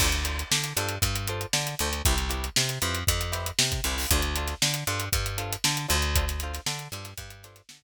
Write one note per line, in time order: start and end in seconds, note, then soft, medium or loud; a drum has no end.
0.00 0.44 D2 loud
0.00 0.09 D4 medium
0.00 0.09 F4 medium
0.00 0.09 A4 medium
0.00 0.09 C5 medium
0.00 kick medium
0.00 crash medium
0.12 closed hi-hat medium
0.24 0.42 D4 medium
0.24 0.42 F4 medium
0.24 0.42 A4 medium
0.24 0.42 C5 medium
0.24 closed hi-hat medium
0.39 closed hi-hat medium
0.51 0.73 D3 medium
0.51 snare medium
0.64 closed hi-hat medium
0.77 0.98 G2 medium
0.77 0.95 D4 medium
0.77 0.95 F4 medium
0.77 0.95 A4 medium
0.77 0.95 C5 medium
0.77 snare soft
0.77 closed hi-hat medium
0.89 closed hi-hat medium
1.02 1.46 G2 medium
1.02 kick medium
1.02 closed hi-hat medium
1.15 closed hi-hat medium
1.27 1.46 D4 medium
1.27 1.46 F4 medium
1.27 1.46 A4 medium
1.27 1.46 C5 medium
1.27 closed hi-hat medium
1.41 closed hi-hat medium
1.53 1.75 D3 medium
1.53 snare medium
1.67 closed hi-hat medium
1.79 2.02 D2 medium
1.79 1.90 D4 medium
1.79 1.90 F4 medium
1.79 1.90 A4 medium
1.79 1.90 C5 medium
1.79 closed hi-hat medium
1.93 closed hi-hat medium
2.05 2.49 C2 loud
2.05 2.15 E4 medium
2.05 2.15 G4 medium
2.05 2.15 B4 medium
2.05 2.15 C5 medium
2.05 kick medium
2.05 closed hi-hat medium
2.18 closed hi-hat medium
2.29 2.47 E4 medium
2.29 2.47 G4 medium
2.29 2.47 B4 medium
2.29 2.47 C5 medium
2.29 closed hi-hat medium
2.44 closed hi-hat medium
2.56 2.79 C3 medium
2.56 snare loud
2.69 closed hi-hat medium
2.82 3.04 F2 medium
2.82 3.00 E4 medium
2.82 3.00 G4 medium
2.82 3.00 B4 medium
2.82 3.00 C5 medium
2.82 closed hi-hat medium
2.95 closed hi-hat medium
3.07 3.52 F2 medium
3.07 kick medium
3.07 closed hi-hat medium
3.21 closed hi-hat medium
3.32 3.50 E4 medium
3.32 3.50 G4 medium
3.32 3.50 B4 medium
3.32 3.50 C5 medium
3.32 snare soft
3.32 closed hi-hat medium
3.46 closed hi-hat medium
3.59 3.80 C3 medium
3.59 snare loud
3.72 kick medium
3.72 closed hi-hat medium
3.84 4.06 C2 medium
3.84 3.95 E4 medium
3.84 3.95 G4 medium
3.84 3.95 B4 medium
3.84 3.95 C5 medium
3.84 closed hi-hat medium
3.98 open hi-hat medium
4.11 4.54 D2 loud
4.11 4.21 D4 medium
4.11 4.21 F4 medium
4.11 4.21 A4 medium
4.11 4.21 C5 medium
4.11 kick medium
4.11 closed hi-hat medium
4.22 closed hi-hat medium
4.35 4.55 D4 medium
4.35 4.55 F4 medium
4.35 4.55 A4 medium
4.35 4.55 C5 medium
4.35 closed hi-hat medium
4.48 snare soft
4.48 closed hi-hat medium
4.62 4.84 D3 medium
4.62 snare medium
4.74 closed hi-hat medium
4.87 5.09 G2 medium
4.87 5.05 D4 medium
4.87 5.05 F4 medium
4.87 5.05 A4 medium
4.87 5.05 C5 medium
4.87 closed hi-hat medium
5.00 closed hi-hat medium
5.13 5.57 G2 medium
5.13 kick medium
5.13 closed hi-hat medium
5.26 closed hi-hat medium
5.38 5.56 D4 medium
5.38 5.56 F4 medium
5.38 5.56 A4 medium
5.38 5.56 C5 medium
5.38 closed hi-hat medium
5.52 closed hi-hat medium
5.64 5.87 D3 loud
5.64 snare medium
5.77 closed hi-hat medium
5.88 6.59 D2 loud
5.88 5.97 D4 medium
5.88 5.97 F4 medium
5.88 5.97 A4 medium
5.88 5.97 C5 medium
5.88 closed hi-hat medium
6.02 closed hi-hat medium
6.15 6.25 D4 medium
6.15 6.25 F4 medium
6.15 6.25 A4 medium
6.15 6.25 C5 medium
6.15 kick medium
6.15 closed hi-hat medium
6.28 snare soft
6.28 closed hi-hat medium
6.40 6.61 D4 medium
6.40 6.61 F4 medium
6.40 6.61 A4 medium
6.40 6.61 C5 medium
6.40 closed hi-hat medium
6.54 snare soft
6.54 closed hi-hat medium
6.66 6.88 D3 medium
6.66 snare medium
6.79 closed hi-hat medium
6.92 7.14 G2 medium
6.92 7.11 D4 medium
6.92 7.11 F4 medium
6.92 7.11 A4 medium
6.92 7.11 C5 medium
6.92 closed hi-hat medium
7.04 snare soft
7.04 closed hi-hat medium
7.18 7.62 G2 medium
7.18 kick medium
7.18 closed hi-hat medium
7.30 closed hi-hat medium
7.43 7.62 D4 medium
7.43 7.62 F4 medium
7.43 7.62 A4 medium
7.43 7.62 C5 medium
7.43 snare soft
7.43 closed hi-hat medium
7.56 snare soft
7.56 closed hi-hat medium
7.69 7.83 D3 medium
7.69 snare loud
7.82 kick medium